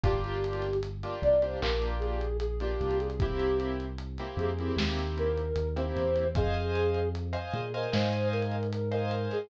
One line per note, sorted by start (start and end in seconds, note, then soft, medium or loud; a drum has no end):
0.03 1.04 G1 medium
0.03 0.67 A#3 loud
0.03 0.67 D4 loud
0.03 0.67 F4 loud
0.03 0.67 G4 loud
0.03 0.77 G4 medium
0.03 kick loud
0.03 closed hi-hat loud
0.24 closed hi-hat medium
0.44 closed hi-hat medium
0.53 closed hi-hat medium
0.62 snare soft
0.62 closed hi-hat medium
0.73 closed hi-hat medium
0.83 closed hi-hat loud
1.03 1.35 A#3 medium
1.03 1.35 D4 medium
1.03 1.35 F4 medium
1.03 1.35 G4 medium
1.03 closed hi-hat medium
1.22 1.56 C2 medium
1.22 1.41 D5 medium
1.22 closed hi-hat medium
1.42 1.58 A#3 medium
1.42 1.58 D4 medium
1.42 1.58 F4 medium
1.42 1.58 G4 medium
1.42 1.61 C5 medium
1.42 closed hi-hat medium
1.61 2.75 A#1 medium
1.61 2.25 A#3 medium
1.61 2.25 D4 medium
1.61 2.25 F4 medium
1.61 2.25 G4 medium
1.61 1.95 A#4 medium
1.61 clap loud
1.82 closed hi-hat medium
2.00 2.37 G#4 medium
2.00 closed hi-hat medium
2.21 closed hi-hat medium
2.40 2.58 G#4 medium
2.40 closed hi-hat loud
2.60 3.08 A#3 medium
2.60 3.08 D4 medium
2.60 3.08 F4 medium
2.60 2.98 G4 medium
2.60 3.08 G4 medium
2.60 closed hi-hat medium
2.81 4.21 C2 medium
2.81 closed hi-hat medium
2.91 closed hi-hat medium
3.00 3.19 G#4 medium
3.00 closed hi-hat medium
3.10 closed hi-hat medium
3.19 3.85 A#3 medium
3.19 3.85 C4 medium
3.19 3.85 E4 loud
3.19 3.57 G4 medium
3.19 3.85 G4 medium
3.19 kick loud
3.19 closed hi-hat loud
3.39 closed hi-hat medium
3.60 closed hi-hat medium
3.80 closed hi-hat medium
3.98 closed hi-hat loud
4.18 4.51 A#3 medium
4.18 4.51 C4 medium
4.18 4.51 E4 medium
4.18 4.51 G4 medium
4.18 snare soft
4.18 closed hi-hat medium
4.37 4.71 F2 medium
4.37 4.73 G#4 medium
4.37 closed hi-hat medium
4.59 4.75 A#3 medium
4.59 4.75 C4 medium
4.59 4.75 E4 medium
4.59 4.75 G4 medium
4.59 closed hi-hat medium
4.77 5.52 D#2 medium
4.77 5.41 A#3 medium
4.77 5.41 C4 medium
4.77 5.41 E4 medium
4.77 5.41 G4 medium
4.77 snare loud
4.99 closed hi-hat medium
5.18 5.69 A#4 medium
5.18 closed hi-hat medium
5.38 closed hi-hat medium
5.56 5.91 D#2 medium
5.56 closed hi-hat loud
5.76 6.24 A#3 medium
5.76 6.24 C4 medium
5.76 6.24 E4 medium
5.76 6.24 G4 medium
5.76 6.27 C5 medium
5.76 closed hi-hat medium
5.96 6.32 E2 medium
5.96 closed hi-hat medium
6.16 closed hi-hat medium
6.35 7.36 F2 medium
6.35 7.09 G#4 medium
6.35 6.99 C5 loud
6.35 6.99 D#5 medium
6.35 6.99 F5 loud
6.35 6.99 G#5 loud
6.35 kick loud
6.35 closed hi-hat loud
6.54 closed hi-hat medium
6.75 closed hi-hat medium
6.94 closed hi-hat medium
7.15 closed hi-hat loud
7.33 7.64 C5 loud
7.33 7.64 D#5 medium
7.33 7.64 F5 medium
7.33 7.64 G#5 medium
7.33 closed hi-hat medium
7.53 7.87 A#2 medium
7.53 7.73 G#4 medium
7.53 closed hi-hat medium
7.74 7.94 A#4 medium
7.74 7.90 C5 medium
7.74 7.90 D#5 medium
7.74 7.90 F5 medium
7.74 7.90 G#5 medium
7.74 closed hi-hat medium
7.92 9.27 G#2 medium
7.92 8.55 C5 medium
7.92 8.28 C5 medium
7.92 8.55 D#5 loud
7.92 8.55 F5 medium
7.92 8.55 G#5 loud
7.92 snare loud
8.13 closed hi-hat medium
8.32 8.68 A#4 medium
8.32 closed hi-hat medium
8.42 closed hi-hat medium
8.51 closed hi-hat medium
8.63 closed hi-hat medium
8.70 8.89 A#4 medium
8.70 closed hi-hat loud
8.91 9.29 A#4 medium
8.91 9.39 C5 medium
8.91 9.39 D#5 medium
8.91 9.39 F5 medium
8.91 9.39 G#5 medium
8.91 closed hi-hat medium
9.11 closed hi-hat medium
9.31 9.49 G#4 medium
9.31 snare soft
9.31 closed hi-hat medium